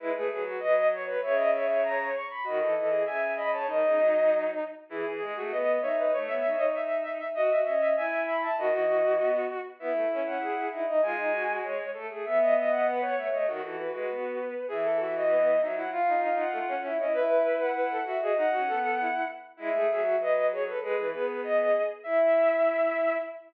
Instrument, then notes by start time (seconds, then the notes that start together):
violin
0.00 G#3 E4 B4
0.15 A3 G#4 B4
0.31 F#3 B4
0.45 F#4
0.60 F#3 B4 D#5
0.92 C#5
1.07 B4
1.22 C#3 C#5 E5
1.36 D#5
1.53 C#5 E5
1.67 C#5
1.83 A#5
2.14 C#6
2.30 B5
2.44 D#3 F#4 D#5
2.61 E3 A4
2.76 E3 D#5
2.90 G#4
3.06 C#3 E5 G#5
3.36 D#5 B5
3.52 C#5 A5
3.67 D#3 D#4 D#5
3.83 C#3
3.97 F#3
4.89 E3 E4 G#4
5.06 E3 G#4
5.20 G#3 G#4
5.36 A3 F#4
5.50 B3 B4 D#5
5.81 D#4 C#5 E5
5.96 B4 D#5
6.13 A3 C#5
6.27 B3 E5
6.44 D#4
6.56 D#4 D#5
6.75 E5
7.02 E5
7.18 E5
7.34 F#4 D#5
7.50 F#4 E5
7.65 C#4 D#5
7.80 E5
7.96 E4 E5 G#5
8.24 E5 B5
8.42 E5 A5
8.57 D#3 F#4 D#5
8.72 E3 D#5
8.88 E3
9.03 E3
9.19 B3
9.79 B3 E4 E5
9.93 A3
10.10 C#4 E5
10.26 C#4 F#5
10.40 G#4
10.71 D#4 E4 E5
10.87 D#4 D#5
11.02 G#3 F4 G#5
11.18 D#4
11.32 F#4
11.50 F#4
11.64 C#5
11.94 A3 A4
12.10 A3 G#4
12.25 B3 E5
12.41 D#5
12.55 D#5 E5
12.70 F#5
12.87 B4
13.02 C#5
13.15 A3 E5
13.30 A3 C#5 D#5
13.47 D#3 F#4
13.62 E3 F#4 A4
13.76 F#4 B4
13.93 G#3 F#4 B4
14.10 B3
14.68 E3 G#4 E5
14.84 A4
15.00 F#4 E5
15.15 F#4 D#5
15.30 B3
15.61 F#3 D#4 E5
15.75 F#3 E4 F#5
15.90 F4 F5
16.08 D#4
16.22 D#4 F5
16.38 F#5
16.52 A3
16.68 C#4
16.84 E4 E5
16.99 C#4 E4 D#5
17.13 E4 B4 E5
17.45 E5
17.60 F#5
17.75 B4
17.90 A4
18.04 F#4 E5
18.21 F#4 G#4 D#5
18.36 D#4 F#5
18.50 C#4 F#4
18.67 B3 A4
18.99 E4
19.57 G#3 E4 E5
19.72 A3 G#4
19.90 F#3 E5
20.03 F#4
20.19 F#3 B4 D#5
20.51 G#4 C#5
20.66 A4 B4
20.82 G#3 G#4 B4
20.98 E3
21.12 B3 G#4 B4
21.26 B4
21.44 D#5
22.04 E4 E5